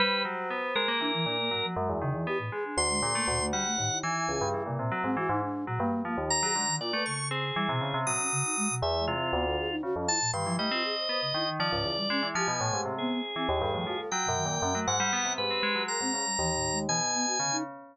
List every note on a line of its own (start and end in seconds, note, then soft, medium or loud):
0.00 0.23 G3 loud
0.00 0.23 B4 loud
0.00 0.91 C5 medium
0.25 0.48 F#3 medium
0.50 0.73 B3 medium
0.75 0.87 G#3 medium
0.75 1.66 A#4 loud
0.88 1.00 A#3 medium
1.00 1.24 E3 medium
1.00 1.12 D4 loud
1.14 1.26 E3 loud
1.26 1.49 A#2 medium
1.26 1.37 D4 medium
1.38 1.50 A#3 medium
1.51 1.62 G#2 medium
1.51 1.74 F#3 medium
1.64 1.75 F3 medium
1.76 1.88 F#2 loud
1.76 1.99 G#3 medium
1.89 2.01 E2 medium
2.02 2.13 C#3 loud
2.02 2.13 D#3 medium
2.14 2.26 E2 medium
2.14 2.26 E3 medium
2.27 2.38 B3 medium
2.27 2.38 G4 loud
2.39 2.50 A2 medium
2.52 2.75 G#3 medium
2.52 2.64 G#4 medium
2.65 2.88 D4 medium
2.77 3.00 D2 medium
2.77 3.46 C6 loud
2.90 3.01 G#3 medium
3.02 3.14 A#2 loud
3.02 3.13 G#4 medium
3.15 3.26 A3 medium
3.15 3.26 A#3 medium
3.28 3.50 D2 loud
3.28 3.39 A#2 loud
3.41 3.52 A3 loud
3.53 3.64 G3 medium
3.53 3.98 F#5 loud
3.66 3.77 A3 medium
3.78 4.01 D#2 medium
3.78 3.90 A2 loud
3.91 4.02 E4 medium
4.03 4.26 E3 loud
4.03 4.48 G#5 soft
4.29 4.40 C#2 medium
4.29 4.63 G#4 medium
4.41 4.53 G2 loud
4.54 4.65 E3 medium
4.66 4.78 A#2 medium
4.66 4.78 C3 medium
4.79 4.91 A#2 loud
4.79 4.90 C3 medium
4.92 5.03 F#3 medium
5.04 5.15 G#2 medium
5.04 5.16 C4 loud
5.17 5.28 E3 medium
5.17 5.29 F#4 loud
5.29 5.41 G#2 loud
5.29 5.41 D#4 loud
5.42 5.65 D4 medium
5.67 5.79 A#2 medium
5.67 5.79 F#3 medium
5.80 5.91 G2 medium
5.80 6.02 A#3 loud
6.05 6.16 F3 medium
6.05 6.17 A#3 medium
6.18 6.40 D#2 medium
6.30 6.76 A#5 loud
6.42 6.54 F#3 medium
6.42 6.53 G#4 loud
6.55 6.67 D3 medium
6.55 6.67 G#3 medium
6.68 6.79 D#3 loud
6.81 6.92 A#2 medium
6.81 6.92 F4 loud
6.81 7.03 D5 medium
6.93 7.05 A3 loud
6.93 7.05 B4 medium
7.06 7.52 C#3 medium
7.06 7.28 C#6 medium
7.31 7.42 C4 medium
7.31 7.99 G#4 medium
7.56 7.68 E3 medium
7.56 7.67 G3 medium
7.69 7.80 B2 loud
7.69 7.80 C3 medium
7.81 7.92 C#3 medium
7.81 7.93 C#3 medium
7.94 8.05 C3 loud
7.94 8.06 C3 medium
8.06 8.18 A#2 medium
8.06 8.75 F#3 medium
8.06 8.75 D#6 medium
8.19 8.31 C#4 medium
8.32 8.43 C#3 loud
8.45 8.56 D#4 medium
8.57 8.68 G#3 loud
8.70 8.82 B2 loud
8.82 9.05 E2 loud
8.82 8.97 B4 medium
8.82 9.05 E5 medium
8.99 9.14 G#3 medium
9.07 9.30 C3 medium
9.07 9.76 F4 medium
9.15 9.30 F4 medium
9.33 9.56 D2 loud
9.33 9.45 B3 medium
9.45 9.56 A4 medium
9.58 9.70 G#4 loud
9.70 9.82 D#4 loud
9.83 9.94 C#3 medium
9.83 9.95 F#4 loud
9.95 10.07 F2 medium
9.95 10.07 C#4 medium
10.08 10.20 E4 medium
10.08 10.31 A5 loud
10.21 10.32 A#2 loud
10.33 10.45 G2 loud
10.33 10.45 D#3 medium
10.33 10.56 C6 medium
10.46 10.58 E3 medium
10.46 10.58 F3 loud
10.58 10.70 G3 medium
10.58 10.69 A3 loud
10.58 11.50 D#5 medium
10.71 10.83 C4 loud
10.71 10.83 F4 medium
10.84 10.95 G#4 medium
10.97 11.08 C5 medium
11.09 11.20 B3 medium
11.09 11.21 C5 medium
11.22 11.33 C#3 medium
11.34 11.57 D#3 medium
11.34 11.46 E4 medium
11.47 11.70 D#3 medium
11.60 11.71 F3 loud
11.60 12.28 D5 medium
11.72 11.84 C#2 medium
11.72 11.84 G#2 medium
11.84 11.96 E2 medium
11.84 11.95 F4 medium
11.97 12.08 G3 medium
12.10 12.21 G#3 loud
12.10 12.22 C#4 loud
12.23 12.34 E3 medium
12.23 12.34 E4 medium
12.35 12.47 F3 loud
12.35 12.48 G4 loud
12.35 12.81 G#5 medium
12.48 12.59 B2 medium
12.60 12.72 A2 medium
12.60 12.71 A#2 loud
12.73 12.85 G#2 medium
12.73 12.96 G4 medium
12.86 13.08 C3 medium
12.98 13.22 B3 loud
12.98 14.01 G#4 medium
13.36 13.47 E3 medium
13.36 13.47 C4 medium
13.49 13.60 D#2 loud
13.61 13.73 G2 medium
13.61 13.72 A4 medium
13.74 13.85 A2 medium
13.74 13.85 F3 medium
13.86 13.98 F3 medium
13.86 13.97 F#4 medium
13.99 14.10 A4 medium
14.11 14.27 F#3 medium
14.11 14.80 G5 medium
14.25 14.44 F#2 medium
14.25 14.36 B2 medium
14.36 14.59 D#3 medium
14.45 14.61 A#2 medium
14.62 14.74 F#2 loud
14.62 14.74 C#4 medium
14.74 14.86 F#3 medium
14.74 14.85 A3 medium
14.88 14.99 G#2 loud
14.88 15.33 F#5 loud
15.00 15.11 G3 loud
15.13 15.24 B3 loud
15.25 15.37 C3 medium
15.38 15.49 G#2 medium
15.38 15.84 G4 medium
15.38 15.83 B4 loud
15.51 15.62 C4 medium
15.63 15.74 G#3 loud
15.75 15.87 F#3 medium
15.88 16.00 G#3 medium
15.88 16.01 A#4 medium
15.88 16.79 A#5 medium
16.01 16.12 G#2 medium
16.01 16.13 C4 loud
16.14 16.25 C#3 soft
16.14 16.25 G#4 medium
16.26 16.37 G3 medium
16.39 16.84 D#2 medium
16.39 16.54 E3 medium
16.55 16.71 A2 medium
16.72 16.87 G#3 medium
16.89 17.35 B2 medium
16.89 17.00 E3 medium
16.89 17.57 G#5 loud
17.15 17.26 B3 loud
17.27 17.38 F#4 medium
17.39 17.62 C#3 medium
17.39 17.50 D3 medium
17.52 17.63 D#4 loud